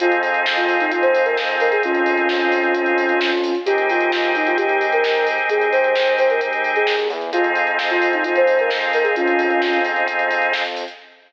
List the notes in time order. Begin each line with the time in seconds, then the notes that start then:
0.00 F2 C4 D#4 F4 G#4, kick, closed hi-hat
0.12 closed hi-hat
0.23 open hi-hat
0.34 closed hi-hat
0.46 kick, snare
0.57 F4, closed hi-hat
0.69 open hi-hat
0.80 D#4, closed hi-hat
0.91 F4, kick, closed hi-hat
1.02 C5, closed hi-hat
1.15 open hi-hat
1.25 A#4, closed hi-hat
1.37 kick, snare
1.49 closed hi-hat
1.60 A#4, open hi-hat
1.71 G#4, closed hi-hat
1.83 F2 C#4 F4, kick, closed hi-hat
1.95 closed hi-hat
2.06 open hi-hat
2.17 closed hi-hat
2.29 kick, snare
2.41 closed hi-hat
2.52 open hi-hat
2.63 closed hi-hat
2.75 kick, closed hi-hat
2.86 closed hi-hat
2.98 open hi-hat
3.09 closed hi-hat
3.21 kick, snare
3.32 closed hi-hat
3.44 open hi-hat
3.55 closed hi-hat
3.66 D#2 C4 D#4 G4 G#4, kick, closed hi-hat
3.78 closed hi-hat
3.89 F4, open hi-hat
4.01 closed hi-hat
4.12 kick, snare
4.24 closed hi-hat
4.35 D#4, open hi-hat
4.47 F4, closed hi-hat
4.57 G4, kick, closed hi-hat
4.69 closed hi-hat
4.81 open hi-hat
4.92 A#4, closed hi-hat
5.04 kick, snare
5.15 closed hi-hat
5.27 open hi-hat
5.38 closed hi-hat
5.49 D#2 G#4, kick, closed hi-hat
5.61 closed hi-hat
5.72 C5, open hi-hat
5.84 closed hi-hat
5.96 kick, snare
6.07 closed hi-hat
6.18 C5, open hi-hat
6.30 A#4, closed hi-hat
6.41 kick, closed hi-hat
6.53 closed hi-hat
6.64 open hi-hat
6.75 G#4, closed hi-hat
6.87 D#2, kick, snare
6.98 closed hi-hat
7.09 E2, open hi-hat
7.21 closed hi-hat
7.33 F2 C4 D#4 F4 G#4, kick, closed hi-hat
7.44 closed hi-hat
7.55 open hi-hat
7.67 closed hi-hat
7.79 kick, snare
7.90 F4, closed hi-hat
8.02 open hi-hat
8.13 D#4, closed hi-hat
8.24 F4, kick, closed hi-hat
8.36 C5, closed hi-hat
8.47 open hi-hat
8.59 A#4, closed hi-hat
8.70 kick, snare
8.81 closed hi-hat
8.93 A#4, open hi-hat
9.04 G#4, closed hi-hat
9.16 F2 C#4 F4, kick, closed hi-hat
9.27 closed hi-hat
9.39 open hi-hat
9.50 closed hi-hat
9.62 kick, snare
9.73 closed hi-hat
9.85 open hi-hat
9.96 closed hi-hat
10.07 kick, closed hi-hat
10.19 closed hi-hat
10.31 open hi-hat
10.42 closed hi-hat
10.53 kick, snare
10.65 closed hi-hat
10.76 open hi-hat
10.88 closed hi-hat